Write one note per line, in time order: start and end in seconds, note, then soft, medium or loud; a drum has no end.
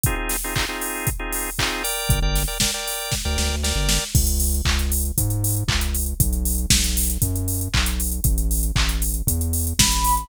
0.04 0.15 C4 medium
0.04 0.15 D#4 medium
0.04 0.15 F4 medium
0.04 0.15 G#4 medium
0.04 kick medium
0.04 closed hi-hat medium
0.16 0.37 C4 medium
0.16 0.37 D#4 medium
0.16 0.37 F4 medium
0.16 0.37 G#4 medium
0.29 snare soft
0.29 open hi-hat medium
0.44 0.54 C4 medium
0.44 0.54 D#4 medium
0.44 0.54 F4 medium
0.44 0.54 G#4 medium
0.55 0.66 C4 medium
0.55 0.66 D#4 medium
0.55 0.66 F4 medium
0.55 0.66 G#4 medium
0.55 kick medium
0.55 clap medium
0.69 1.10 C4 medium
0.69 1.10 D#4 medium
0.69 1.10 F4 medium
0.69 1.10 G#4 medium
0.82 open hi-hat medium
1.07 kick medium
1.07 closed hi-hat medium
1.19 1.50 C4 medium
1.19 1.50 D#4 medium
1.19 1.50 F4 medium
1.19 1.50 G#4 medium
1.33 open hi-hat medium
1.59 1.83 C4 medium
1.59 1.83 D#4 medium
1.59 1.83 F4 medium
1.59 1.83 G#4 medium
1.59 kick medium
1.59 clap loud
1.84 2.20 A#4 medium
1.84 2.20 D5 medium
1.84 2.20 G5 medium
1.84 open hi-hat medium
2.09 2.21 G1 medium
2.09 kick loud
2.09 closed hi-hat medium
2.22 2.45 G1 medium
2.22 2.43 A#4 medium
2.22 2.43 D5 medium
2.22 2.43 G5 medium
2.35 snare soft
2.35 open hi-hat medium
2.48 2.58 A#4 medium
2.48 2.58 D5 medium
2.48 2.58 G5 medium
2.60 2.71 A#4 medium
2.60 2.71 D5 medium
2.60 2.71 G5 medium
2.60 kick medium
2.60 snare medium
2.74 3.15 A#4 medium
2.74 3.15 D5 medium
2.74 3.15 G5 medium
2.88 open hi-hat medium
3.12 kick medium
3.12 snare medium
3.25 3.37 D2 medium
3.25 3.56 A#4 medium
3.25 3.56 D5 medium
3.25 3.56 G5 medium
3.38 3.49 D2 medium
3.38 snare medium
3.50 3.73 D2 medium
3.63 4.04 A#4 medium
3.63 4.04 D5 medium
3.63 4.04 G5 medium
3.63 snare medium
3.76 3.99 G1 medium
3.89 snare medium
4.15 4.61 C#2 medium
4.15 kick loud
4.15 crash medium
4.27 closed hi-hat medium
4.40 open hi-hat medium
4.54 closed hi-hat medium
4.65 5.12 C#2 medium
4.65 kick medium
4.65 clap loud
4.79 closed hi-hat medium
4.92 open hi-hat medium
5.05 closed hi-hat medium
5.18 5.64 G#2 medium
5.18 kick medium
5.18 closed hi-hat loud
5.30 closed hi-hat medium
5.44 open hi-hat medium
5.57 closed hi-hat medium
5.68 6.14 C#2 medium
5.68 kick medium
5.68 clap loud
5.81 closed hi-hat medium
5.95 open hi-hat medium
6.06 closed hi-hat medium
6.20 6.66 B1 medium
6.20 kick loud
6.20 closed hi-hat loud
6.33 closed hi-hat medium
6.45 open hi-hat medium
6.58 closed hi-hat medium
6.70 7.18 B1 medium
6.70 kick medium
6.70 snare loud
6.84 closed hi-hat medium
6.97 open hi-hat medium
7.10 closed hi-hat medium
7.22 7.69 F#2 medium
7.22 kick medium
7.22 closed hi-hat medium
7.36 closed hi-hat medium
7.48 open hi-hat medium
7.61 closed hi-hat medium
7.74 8.20 B1 medium
7.74 kick medium
7.74 clap loud
7.86 closed hi-hat medium
8.00 open hi-hat medium
8.12 closed hi-hat medium
8.24 8.71 A1 medium
8.24 kick medium
8.24 closed hi-hat medium
8.38 closed hi-hat medium
8.51 open hi-hat medium
8.63 closed hi-hat medium
8.76 9.22 A1 medium
8.76 kick medium
8.76 clap loud
8.89 closed hi-hat medium
9.02 open hi-hat medium
9.14 closed hi-hat medium
9.27 9.73 E2 medium
9.27 kick medium
9.27 closed hi-hat loud
9.41 closed hi-hat medium
9.53 open hi-hat medium
9.67 closed hi-hat medium
9.79 10.25 A1 medium
9.79 10.28 B5 medium
9.79 kick medium
9.79 snare loud
9.92 closed hi-hat medium
10.04 open hi-hat medium
10.17 closed hi-hat medium